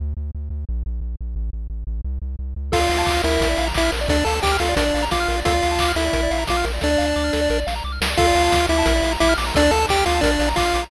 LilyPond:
<<
  \new Staff \with { instrumentName = "Lead 1 (square)" } { \time 4/4 \key d \minor \tempo 4 = 176 r1 | r1 | <f' f''>4. <e' e''>4. <e' e''>8 r8 | <d' d''>8 <a' a''>8 <g' g''>8 <f' f''>8 <d' d''>4 <f' f''>4 |
<f' f''>4. <e' e''>4. <f' f''>8 r8 | <d' d''>2~ <d' d''>8 r4. | <f' f''>4. <e' e''>4. <e' e''>8 r8 | <d' d''>8 <a' a''>8 <g' g''>8 <f' f''>8 <d' d''>4 <f' f''>4 | }
  \new Staff \with { instrumentName = "Lead 1 (square)" } { \time 4/4 \key d \minor r1 | r1 | a'16 d''16 f''16 a''16 d'''16 f'''16 bes'8. d''16 f''16 bes''16 d'''16 f'''16 bes'16 d''16 | a'16 d''16 f''16 a''16 d'''16 f'''16 a'16 d''16 bes'16 d''16 f''16 bes''16 d'''16 f'''16 bes'16 d''16 |
a'16 d''16 f''16 a''16 d'''16 f'''16 a'16 d''16 bes'16 d''16 f''16 bes''16 d'''16 f'''16 bes'16 d''16 | a'16 d''16 f''16 a''16 d'''16 f'''16 a'16 d''16 bes'16 d''16 f''16 bes''16 d'''16 f'''16 bes'16 d''16 | a'16 d''16 f''16 a''16 d'''16 f'''16 d'''16 a''16 bes'16 d''16 f''16 bes''16 d'''16 f'''16 d'''16 bes''16 | a'16 d''16 f''16 a''16 d'''16 f'''16 d'''16 a''16 bes'16 d''16 f''16 bes''16 d'''16 f'''16 d'''16 bes''16 | }
  \new Staff \with { instrumentName = "Synth Bass 1" } { \clef bass \time 4/4 \key d \minor d,8 d,8 d,8 d,8 bes,,8 bes,,8 bes,,8 bes,,8 | a,,8 a,,8 a,,8 a,,8 c,8 c,8 c,8 cis,8 | d,8 d,8 d,8 d,8 bes,,8 bes,,8 bes,,8 bes,,8 | d,8 d,8 d,8 d,8 bes,,8 bes,,8 bes,,8 bes,,8 |
d,8 d,8 d,8 d,8 bes,,8 bes,,8 bes,,8 bes,,8 | d,8 d,8 d,8 d,8 bes,,8 bes,,8 c,8 cis,8 | d,8 d,8 d,8 d,8 bes,,8 bes,,8 bes,,8 bes,,8 | d,8 d,8 d,8 d,8 bes,,8 bes,,8 bes,,8 bes,,8 | }
  \new DrumStaff \with { instrumentName = "Drums" } \drummode { \time 4/4 r4 r4 r4 r4 | r4 r4 r4 r4 | <cymc bd>8 hho8 <hc bd>8 hho8 <hh bd>8 hho8 <hc bd>8 hho8 | <hh bd>8 hho8 <hc bd>8 hho8 <hh bd>8 hho8 <bd sn>8 hho8 |
<hh bd>8 hho8 <hc bd>8 hho8 <hh bd>8 hho8 <bd sn>8 hho8 | <bd sn>8 sn8 sn8 sn8 sn8 sn8 r8 sn8 | <cymc bd>8 hho8 <bd sn>8 hho8 <hh bd>8 hho8 <bd sn>8 hho8 | <hh bd>8 hho8 <hc bd>8 hho8 <hh bd>8 hho8 <hc bd>8 hho8 | }
>>